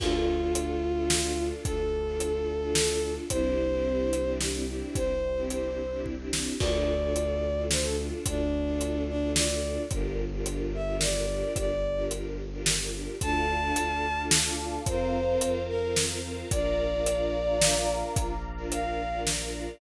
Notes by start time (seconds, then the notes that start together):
0.00 D2 D4 F4 A4, kick, crash
0.41 D4 F4 A4
0.55 closed hi-hat
0.96 D4 F4 A4
1.10 snare
1.24 D4 F4 A4
1.38 D4 F4 A4
1.65 D2 A4, kick, closed hi-hat
2.06 D4 F4 A4
2.20 closed hi-hat
2.61 D4 F4 A4
2.75 snare
2.89 D4 F4 A4
3.02 D4 F4 A4
3.30 C2 C4 D4 E4 G4 C5, kick, closed hi-hat
3.72 C4 D4 E4 G4
4.13 closed hi-hat
4.26 C4 D4 E4 G4
4.41 snare
4.54 C4 D4 E4 G4
4.68 C4 D4 E4 G4
4.95 C2 C5, kick, closed hi-hat
5.37 C4 D4 E4 G4
5.50 C5, closed hi-hat
5.92 C4 D4 E4 G4
6.06 kick
6.19 C4 D4 E4 G4
6.33 C4 D4 E4 G4, snare
6.60 D2 D4 F4 A4 D5, kick, crash
7.02 D4 F4 A4
7.16 closed hi-hat
7.57 D4 F4 A4
7.71 C5, snare
7.82 D4 F4 A4
7.98 D4 F4 A4
8.26 D2 D4, kick, closed hi-hat
8.67 D4 F4 A4
8.81 closed hi-hat
9.09 D4
9.22 D4 F4 A4
9.35 D5, snare
9.49 D4 F4 A4
9.63 D4 F4 A4
9.91 G1 D4 F4 G4 A#4, kick, closed hi-hat
10.32 D4 F4 G4 A#4
10.46 closed hi-hat
10.74 E5
10.88 D4 F4 G4 A#4
11.01 D5, snare
11.15 D4 F4 G4 A#4
11.29 D4 F4 G4 A#4
11.56 G1 D5, kick, closed hi-hat
11.97 D4 F4 G4 A#4
12.11 closed hi-hat
12.52 D4 F4 G4 A#4
12.66 snare
12.80 D4 F4 G4 A#4
12.94 D4 F4 G4 A#4
13.20 D2 D4 F4 A4 D5 F5 A5, kick, closed hi-hat
13.62 D4 F4 A4
13.76 D2, closed hi-hat
14.17 D4 F4 A4
14.31 snare
14.45 D4 F4 A4
14.59 D4 F4 A4
14.86 F2 C4 F4 A#4 C5 F5 A#5, kick, closed hi-hat
15.28 C4 F4 A#4
15.41 F2, closed hi-hat
15.69 A#4
15.83 C4 F4 A#4
15.96 snare
16.10 C4 F4 A#4
16.24 C4 F4 A#4
16.51 A#1 D4 F4 A#4 D5 F5 A#5, kick, closed hi-hat
16.93 D4 F4 A#4
17.06 closed hi-hat
17.48 D4 F4 A#4
17.61 snare
17.75 D4 F4 A#4
17.89 D4 F4 A#4
18.16 A#1, kick, closed hi-hat
18.58 D4 F4 A#4
18.72 F5, closed hi-hat
19.13 D4 F4 A#4
19.27 snare
19.40 D4 F4 A#4
19.54 D4 F4 A#4